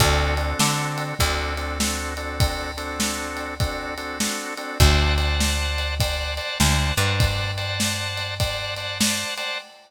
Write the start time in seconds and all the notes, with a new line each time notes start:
0.00 D2 C4 D4 F#4 A4, kick, ride
0.37 C4 D4 F#4 A4, ride
0.59 D3, snare
0.98 ride
1.19 D2 C4 D4 F#4 A4, kick, ride
1.57 C4 D4 F#4 A4, ride
1.80 C4 D4 F#4 A4, snare
2.17 C4 D4 F#4 A4, ride
2.40 kick, ride
2.77 C4 D4 F#4 A4, ride
3.00 snare
3.37 ride
3.60 C4 D4 F#4 A4, kick, ride
3.97 C4 D4 F#4 A4, ride
4.20 C4 D4 F#4 A4, snare
4.57 C4 D4 F#4 A4, ride
4.80 D2 C5 D5 F#5 A5, kick, ride
5.17 C5 D5 F#5 A5, ride
5.40 snare
5.78 ride
6.00 C5 D5 F#5 A5, kick, ride
6.37 C5 D5 F#5 A5, ride
6.60 D2 C5 D5 F#5 A5, snare
6.97 G2 C5 D5 F#5 A5, ride
7.20 kick, ride
7.57 C5 D5 F#5 A5, ride
7.80 snare
8.17 ride
8.40 C5 D5 F#5 A5, kick, ride
8.76 C5 D5 F#5 A5, ride
9.00 C5 D5 F#5 A5, snare
9.37 C5 D5 F#5 A5, ride